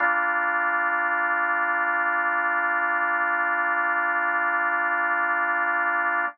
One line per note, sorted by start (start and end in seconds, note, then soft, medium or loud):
0.00 6.25 G3 medium
0.00 6.25 A#3 medium
0.00 6.25 D4 medium
0.00 6.25 F4 medium